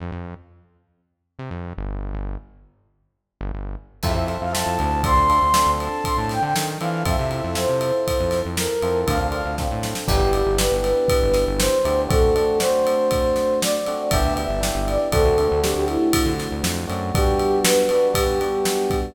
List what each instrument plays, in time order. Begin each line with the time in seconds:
0.00 synth bass 1 F2
0.12 synth bass 1 F2
1.39 synth bass 1 C3
1.51 synth bass 1 F2
1.77 synth bass 1 G1
2.14 synth bass 1 G1
3.41 synth bass 1 G1
3.54 synth bass 1 G1
4.03 synth bass 1 F2, electric piano 1 C4 E4 F4 A4, flute E5, kick, crash
4.15 synth bass 1 F2, flute E5
4.27 electric piano 1 C4 E4 F4 A4, ride
4.41 synth bass 1 F2, flute F5
4.53 electric piano 1 C4 E4 F4 A4, flute A5, snare
4.66 synth bass 1 F2
4.79 synth bass 1 D2, ride
5.04 electric piano 1 C4 D4 F4 A4, flute C6, kick, ride
5.17 synth bass 1 D2
5.30 electric piano 1 C4 D4 F4 A4, ride
5.42 synth bass 1 D2
5.54 electric piano 1 C4 D4 F4 A4, snare
5.66 synth bass 1 D2
5.80 flute A5, ride
6.04 flute C6, kick, ride
6.17 synth bass 1 A2, flute A5
6.29 flute G5, snare, ride
6.42 synth bass 1 D3, flute G5
6.56 synth bass 1 D#3, snare
6.80 synth bass 1 E3, electric piano 1 C4 D4 F4 A4, flute F5, ride
7.05 synth bass 1 F2, electric piano 1 C4 E4 F4 A4, flute E5, kick, ride
7.19 synth bass 1 C3
7.31 electric piano 1 C4 E4 F4 A4, ride
7.44 synth bass 1 F2
7.55 electric piano 1 C4 E4 F4 A4, flute C5, snare
7.69 synth bass 1 C3
7.81 ride
8.08 kick, ride
8.20 synth bass 1 F2
8.31 snare, ride
8.45 synth bass 1 F2
8.57 flute A#4, snare
8.82 synth bass 1 F2, electric piano 1 C4 E4 F4 A4, ride
9.07 synth bass 1 D2, electric piano 1 C4 D4 F4 A4, flute F5, kick, ride
9.20 synth bass 1 D2, flute F5
9.32 electric piano 1 C4 D4 F4 A4, ride
9.45 synth bass 1 D2
9.58 electric piano 1 C4 D4 F4 A4, kick, snare
9.71 synth bass 1 A2
9.83 snare
9.95 snare
10.08 synth bass 1 G1, electric piano 1 B3 D4 E4 G4, flute G4, kick, crash
10.21 synth bass 1 G1
10.33 electric piano 1 B3 D4 E4 G4, ride
10.46 synth bass 1 G1
10.58 electric piano 1 B3 D4 E4 G4, flute B4, snare
10.72 synth bass 1 G1
10.84 ride
11.08 kick, ride
11.23 synth bass 1 G1
11.34 snare, ride
11.47 synth bass 1 G1
11.59 flute C5, snare
11.85 synth bass 1 D2, electric piano 1 B3 D4 E4 G4, ride
12.09 electric piano 1 A3 C4 D4 F#4, flute A4, kick, ride
12.36 electric piano 1 A3 C4 D4 F#4, ride
12.60 electric piano 1 A3 C4 D4 F#4, flute C5, snare
12.87 ride
13.11 kick, ride
13.36 snare, ride
13.61 flute D5, snare
13.86 electric piano 1 A3 C4 D4 F#4, ride
14.11 synth bass 1 G1, electric piano 1 B3 D4 E4 G4, flute E5, kick, ride
14.24 synth bass 1 D2
14.37 electric piano 1 B3 D4 E4 G4, flute E5, ride
14.49 synth bass 1 G1
14.61 electric piano 1 B3 D4 E4 G4, snare
14.75 synth bass 1 G1
14.87 flute D5, ride
15.12 synth bass 1 D2, electric piano 1 A3 C4 D4 F#4, flute A4, kick, ride
15.25 synth bass 1 D2
15.38 electric piano 1 A3 C4 D4 F#4, ride
15.51 synth bass 1 D2
15.62 electric piano 1 A3 C4 D4 F#4, flute G4, snare
15.75 synth bass 1 D2, flute G4
15.88 flute E4, ride
16.13 kick, ride
16.26 synth bass 1 D3
16.39 snare, ride
16.51 synth bass 1 D2
16.63 synth bass 1 F2, snare
16.87 synth bass 1 F#2, electric piano 1 A3 C4 D4 F#4, ride
17.14 electric piano 1 G3 B3 D4 F#4, flute G4, kick, ride
17.39 ride
17.64 flute B4, snare
17.89 electric piano 1 G3 B3 D4 F#4, ride
18.14 electric piano 1 G3 B3 D4 F#4, flute G4, kick, ride
18.41 electric piano 1 G3 B3 D4 F#4, ride
18.65 snare
18.90 kick, ride